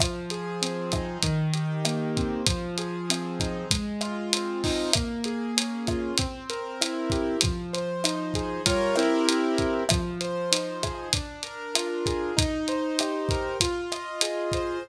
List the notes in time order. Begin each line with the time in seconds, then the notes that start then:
0.00 F3, kick, cross-stick, closed hi-hat
0.30 G#4, closed hi-hat
0.62 C4, closed hi-hat
0.92 D#4, kick, cross-stick, closed hi-hat
1.23 D#3, kick, closed hi-hat
1.53 G4, closed hi-hat
1.85 A#3, cross-stick, closed hi-hat
2.16 C4, kick, closed hi-hat
2.47 F3, kick, closed hi-hat
2.78 G#4, closed hi-hat
3.10 C4, cross-stick, closed hi-hat
3.40 D#4, kick, closed hi-hat
3.71 G#3, kick, closed hi-hat
4.01 F4, cross-stick, closed hi-hat
4.33 C4, closed hi-hat
4.64 D#4, kick, open hi-hat
4.93 A#3, kick, cross-stick, closed hi-hat
5.24 G#4, closed hi-hat
5.57 C#4, closed hi-hat
5.87 F4, kick, cross-stick, closed hi-hat
6.18 C4, kick, closed hi-hat
6.50 A#4, closed hi-hat
6.81 E4, cross-stick, closed hi-hat
7.10 G4, kick, closed hi-hat
7.41 F3, kick, closed hi-hat
7.73 C5, closed hi-hat
8.04 D#4, cross-stick, closed hi-hat
8.34 G#4, kick, closed hi-hat
8.66 G3 F4 A#4 C#5, kick, closed hi-hat
8.96 C4 E4 G4 A#4, cross-stick, closed hi-hat
9.29 closed hi-hat
9.58 kick, closed hi-hat
9.89 F3, kick, cross-stick, closed hi-hat
10.21 C5, closed hi-hat
10.52 D#4, closed hi-hat
10.83 G#4, kick, cross-stick, closed hi-hat
11.13 D4, kick, closed hi-hat
11.43 A#4, closed hi-hat
11.75 F4, cross-stick, closed hi-hat
12.06 G#4, kick, closed hi-hat
12.37 D#4, kick, closed hi-hat
12.68 C5, closed hi-hat
12.99 G4, cross-stick, closed hi-hat
13.29 A#4, kick, closed hi-hat
13.60 F4, kick, closed hi-hat
13.92 D#5, cross-stick, closed hi-hat
14.21 G#4, closed hi-hat
14.52 C5, kick, closed hi-hat